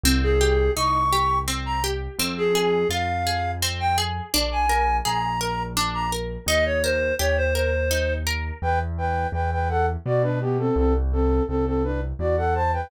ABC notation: X:1
M:3/4
L:1/16
Q:1/4=84
K:Ab
V:1 name="Clarinet"
z A3 d'4 z b z2 | z A3 f4 z g z2 | z a3 b4 z b z2 | e d c2 d c c4 z2 |
[K:G] z12 | z12 |]
V:2 name="Flute"
z12 | z12 | z12 | z12 |
[K:G] [Bg] z [Bg]2 [Bg] [Bg] [Af] z [Fd] [DB] [B,G] [CA] | [CA] z [CA]2 [CA] [CA] [DB] z [Fd] [Af] [ca] [Bg] |]
V:3 name="Orchestral Harp"
C2 G2 E2 G2 C2 G2 | C2 A2 F2 A2 C2 A2 | =D2 B2 A2 B2 D2 B2 | E2 B2 G2 B2 E2 B2 |
[K:G] z12 | z12 |]
V:4 name="Acoustic Grand Piano" clef=bass
C,,4 C,,8 | F,,4 F,,8 | B,,,4 B,,,8 | E,,4 E,,8 |
[K:G] E,,4 E,,4 B,,4 | C,,4 C,,4 E,,4 |]